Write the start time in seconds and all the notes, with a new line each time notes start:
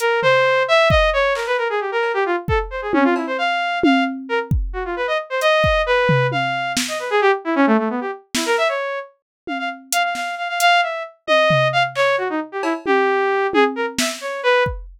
0.00 A#4, closed hi-hat
0.22 C5, floor tom
0.68 E5
0.90 D#5, kick
1.13 C#5
1.35 A#4, clap
1.47 B4
1.58 A#4
1.70 G#4
1.80 G4
1.92 A#4
2.03 cowbell
2.14 G4
2.26 F4
2.48 A4, kick
2.70 C5
2.82 G#4
2.93 C#4, high tom
3.04 F4
3.16 E4, cowbell
3.27 C5
3.38 F5
3.83 F5, high tom
4.29 A#4
4.51 kick
4.73 F#4
4.85 F4
4.96 B4
5.07 D#5
5.30 C5
5.41 D#5, closed hi-hat
5.64 kick
5.86 B4
6.09 floor tom
6.32 F5, high tom
6.77 snare
6.88 D#5
6.99 B4
7.10 G#4
7.21 G4
7.45 E4
7.56 C#4
7.67 A3
7.78 A3
7.90 B3
8.01 G4
8.35 E4, snare
8.46 A#4
8.58 E5
8.69 C#5
9.47 F5, high tom
9.59 F5
9.92 F5, closed hi-hat
10.04 F5
10.15 F5, snare
10.38 F5
10.49 F5
10.60 F5, closed hi-hat
10.83 E5
11.27 D#5, high tom
11.50 floor tom
11.73 F5
11.95 C#5, clap
12.18 F#4
12.30 D#4
12.52 G4
12.63 E4, cowbell
12.86 G4, high tom
13.53 G#4, high tom
13.76 A#4
13.98 E5, snare
14.21 C#5
14.43 B4
14.66 kick